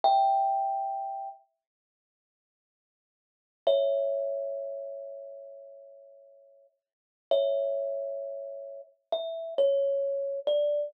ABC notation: X:1
M:4/4
L:1/8
Q:1/4=66
K:Amix
V:1 name="Kalimba"
[eg]3 z5 | [ce]8 | [ce]4 e c2 d |]